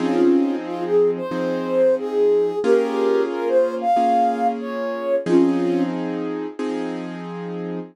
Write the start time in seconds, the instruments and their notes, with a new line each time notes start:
0.00 acoustic grand piano F3 C4 D#4 G#4, ocarina C#4 F4
0.66 ocarina F4
0.85 ocarina G#4
1.17 ocarina C5
1.31 acoustic grand piano F3 C4 D#4 G#4
1.98 ocarina G#4
2.64 acoustic grand piano A#3 C#4 F4 G#4, ocarina G4 A#4
3.31 ocarina A#4
3.48 ocarina C5
3.81 ocarina F5
3.96 acoustic grand piano A#3 C#4 F4 G#4
4.61 ocarina C#5
5.26 acoustic grand piano F3 C4 D#4 G#4, ocarina C#4 F4
6.59 acoustic grand piano F3 C4 D#4 G#4